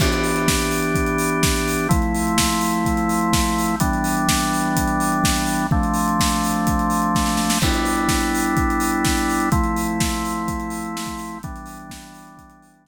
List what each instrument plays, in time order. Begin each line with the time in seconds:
0.00 drawbar organ E3 B3 D4 G4, kick, crash
0.12 closed hi-hat
0.24 open hi-hat
0.36 closed hi-hat
0.48 kick, snare
0.60 closed hi-hat
0.71 open hi-hat
0.82 closed hi-hat
0.95 kick, closed hi-hat
1.07 closed hi-hat
1.18 open hi-hat
1.31 closed hi-hat
1.43 kick, snare
1.56 closed hi-hat
1.68 open hi-hat
1.78 closed hi-hat
1.89 drawbar organ F3 A3 C4 E4, kick, closed hi-hat
2.02 closed hi-hat
2.15 open hi-hat
2.27 closed hi-hat
2.38 kick, snare
2.51 closed hi-hat
2.61 open hi-hat
2.73 closed hi-hat
2.85 kick, closed hi-hat
2.97 closed hi-hat
3.09 open hi-hat
3.21 closed hi-hat
3.33 kick, snare
3.46 closed hi-hat
3.58 open hi-hat
3.68 closed hi-hat
3.80 drawbar organ E3 G3 B3 D4, kick, closed hi-hat
3.93 closed hi-hat
4.04 open hi-hat
4.17 closed hi-hat
4.29 kick, snare
4.39 closed hi-hat
4.53 open hi-hat
4.64 closed hi-hat
4.76 kick, closed hi-hat
4.88 closed hi-hat
5.00 open hi-hat
5.12 closed hi-hat
5.24 kick, snare
5.37 closed hi-hat
5.46 open hi-hat
5.58 closed hi-hat
5.71 drawbar organ F3 A3 C4 D4, kick
5.83 closed hi-hat
5.94 open hi-hat
6.08 closed hi-hat
6.20 kick, snare
6.30 closed hi-hat
6.44 open hi-hat
6.54 closed hi-hat
6.67 kick, closed hi-hat
6.79 closed hi-hat
6.90 open hi-hat
7.02 closed hi-hat
7.15 kick, snare
7.26 snare
7.37 snare
7.50 snare
7.62 drawbar organ G3 B3 D4 E4, kick, crash
7.73 closed hi-hat
7.85 open hi-hat
7.97 closed hi-hat
8.09 kick, snare
8.21 closed hi-hat
8.35 open hi-hat
8.46 closed hi-hat
8.57 kick, closed hi-hat
8.70 closed hi-hat
8.80 open hi-hat
8.92 closed hi-hat
9.05 kick, snare
9.17 closed hi-hat
9.30 open hi-hat
9.40 closed hi-hat
9.52 drawbar organ F3 A3 C4 E4, kick, closed hi-hat
9.64 closed hi-hat
9.76 open hi-hat
9.88 closed hi-hat
10.00 kick, snare
10.12 closed hi-hat
10.25 open hi-hat
10.35 closed hi-hat
10.48 kick, closed hi-hat
10.60 closed hi-hat
10.70 open hi-hat
10.85 closed hi-hat
10.97 snare
11.06 kick, closed hi-hat
11.18 open hi-hat
11.31 closed hi-hat
11.43 drawbar organ E3 G3 B3 D4, kick, closed hi-hat
11.56 closed hi-hat
11.66 open hi-hat
11.79 closed hi-hat
11.90 kick, snare
12.01 closed hi-hat
12.14 open hi-hat
12.27 closed hi-hat
12.37 kick, closed hi-hat
12.50 closed hi-hat
12.62 open hi-hat
12.74 closed hi-hat
12.85 kick, snare